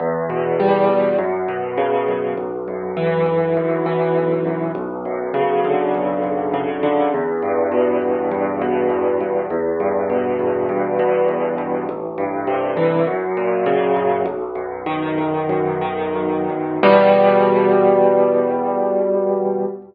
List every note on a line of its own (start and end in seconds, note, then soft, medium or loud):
0.00 0.89 E2 medium
0.30 1.14 B2 medium
0.60 1.16 G3 medium
0.89 1.18 E2 medium
1.19 2.08 F#2 medium
1.48 2.33 B2 medium
1.77 2.34 C#3 medium
2.08 2.37 F#2 medium
2.37 3.26 B1 medium
2.68 3.56 F#2 medium
2.97 3.85 E3 medium
3.26 4.16 B1 medium
3.57 4.45 F#2 medium
3.86 4.71 E3 medium
4.16 4.73 B1 medium
4.45 4.74 F#2 medium
4.75 5.94 B1 medium
5.05 6.23 F#2 medium
5.34 6.53 C#3 medium
5.64 6.82 D3 medium
5.94 7.07 B1 medium
6.24 7.08 F#2 medium
6.54 7.10 C#3 medium
6.83 7.11 D3 medium
7.14 8.01 E2 medium
7.42 8.31 G2 medium
7.72 8.61 B2 medium
8.02 8.90 E2 medium
8.31 9.20 G2 medium
8.62 9.46 B2 medium
8.90 9.47 E2 medium
9.21 9.49 G2 medium
9.50 10.39 E2 medium
9.80 10.68 G2 medium
10.10 10.99 B2 medium
10.39 11.28 E2 medium
10.69 11.58 G2 medium
10.99 11.84 B2 medium
11.28 11.85 E2 medium
11.58 11.86 G2 medium
11.89 13.02 A1 medium
12.18 13.02 G2 medium
12.47 13.04 C3 medium
12.77 13.05 E3 medium
13.07 13.96 F#2 medium
13.37 14.22 A#2 medium
13.66 14.23 C#3 medium
13.97 14.25 F#2 medium
14.26 15.17 B1 medium
14.55 15.49 F#2 medium
14.86 15.81 D#3 medium
15.18 16.14 B1 medium
15.49 16.49 F#2 medium
15.81 16.78 D#3 medium
16.15 16.80 B1 medium
16.50 16.83 F#2 medium
16.83 19.65 E2 medium
16.83 19.65 B2 loud
16.83 19.65 G3 medium